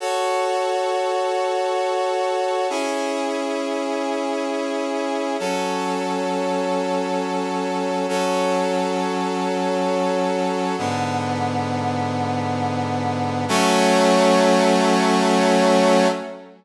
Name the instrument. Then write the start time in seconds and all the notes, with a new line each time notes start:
brass section
0.00 F#4 A4 C#5
2.70 C#4 E4 G#4
5.39 F#3 C#4 A4
8.09 F#3 C#4 A4
10.78 G#2 D3 B3
13.48 F#3 A3 C#4